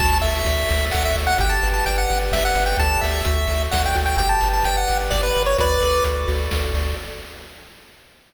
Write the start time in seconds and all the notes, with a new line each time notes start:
0.00 D2 F#4 A5, kick, crash
0.22 D2 A4 E5, open hi-hat
0.45 D2 D5, kick, closed hi-hat
0.69 D2 F#4, open hi-hat
0.91 D2 A4 F#5, kick, clap
1.05 E5
1.16 D2 D5, open hi-hat
1.27 F#5
1.38 G1 G4 G5, kick, closed hi-hat
1.49 A5
1.63 G1 B4, open hi-hat
1.74 A5
1.86 G1 D5 G5, kick, closed hi-hat
1.98 F#5
2.09 G1 G4, open hi-hat
2.32 G1 B4 E5, kick, snare
2.45 F#5
2.55 G1 D5, open hi-hat
2.66 G5
2.77 D2 G4 A4 D5 A5, kick, closed hi-hat
3.01 D2 E5, open hi-hat
3.25 D2 F#4, kick, closed hi-hat
3.47 D2 A4, open hi-hat
3.71 D2 D5 F#5, kick, snare
3.86 G5
3.95 D2 F#4, open hi-hat
4.06 G5
4.17 G1 G4 G5, kick, closed hi-hat
4.29 A5
4.41 G1 B4, open hi-hat
4.53 A5
4.63 G1 D5 G5, kick, closed hi-hat
4.77 F#5
4.88 G1 G4, open hi-hat
5.10 G1 B4 D5, kick, snare
5.23 B4
5.35 G1 D5, open hi-hat
5.46 C#5
5.58 D2 F#4 B4 D5, kick, closed hi-hat
5.80 D2 A4, open hi-hat
6.04 D2 D5, kick, closed hi-hat
6.28 D2 F#4, open hi-hat
6.51 D2 A4, kick, snare
6.74 D2 D5, open hi-hat